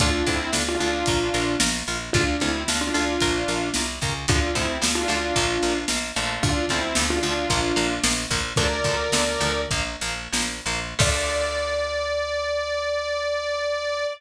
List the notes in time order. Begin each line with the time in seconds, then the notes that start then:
0.00 D2 D4 F4 A4, kick, closed hi-hat
0.26 D2 C4 D4 E4 F4 A4, kick, closed hi-hat
0.53 D2 D4 F4 A4, snare
0.68 D4 F4
0.80 D2 D4 F4 A4, closed hi-hat
1.06 A#1 F4 A#4, kick, closed hi-hat
1.34 A#1 F4 A#4, closed hi-hat
1.60 A#1 F4 A#4, snare
1.87 A#1 F4 A#4, closed hi-hat
2.13 D2 D4 F4 A4, kick, closed hi-hat
2.40 D2 C4 D4 E4 F4 A4, closed hi-hat
2.68 D2 D4 F4 A4, snare
2.81 D4 F4
2.94 D2 D4 F4 A4, closed hi-hat
3.20 A#1 F4 A#4, kick, closed hi-hat
3.48 A#1 F4 A#4, closed hi-hat
3.74 C2 F4 A#4, snare
4.01 C#2 F4 A#4, kick, open hi-hat
4.28 D2 D3 F3 A3 D4 F4, kick, closed hi-hat
4.55 D2 D3 F3 A3 C4 E4, kick, closed hi-hat
4.82 D2 D3 F3 A3, snare
4.95 D4 F4
5.08 D2 D3 F3 A3 D4 F4, closed hi-hat
5.36 A#1 F3 A#3, kick, closed hi-hat
5.62 A#1 F3 A#3, closed hi-hat
5.88 A#1 F3 A#3, snare
6.16 A#1 D3 F3 A3, closed hi-hat
6.43 D2 D4 F4, kick, closed hi-hat
6.69 D2 D3 F3 A3 C4 E4, kick, closed hi-hat
6.95 D2 D3 F3 A3, snare
7.10 D4 F4
7.23 D2 D3 F3 A3 D4 F4, closed hi-hat
7.50 A#1 F3 A#3, kick, closed hi-hat
7.76 A#1 F3 A#3, closed hi-hat
8.04 A#1 F3 A#3, snare
8.30 A#1 F3 A#3, kick, open hi-hat
8.56 D2 D3 F3 A3 A#4 D5, kick, closed hi-hat
8.84 D2 D3 F3 A3, kick, closed hi-hat
9.12 D2 D3 F3 A3, snare
9.41 D2 D3 F3 A3, closed hi-hat
9.71 A#1 F3 A#3, kick, closed hi-hat
10.01 A#1 F3 A#3, closed hi-hat
10.32 A#1 F3 A#3, snare
10.66 A#1 F3 A#3, closed hi-hat
10.99 D2 D3 F3 A3 D5, kick, crash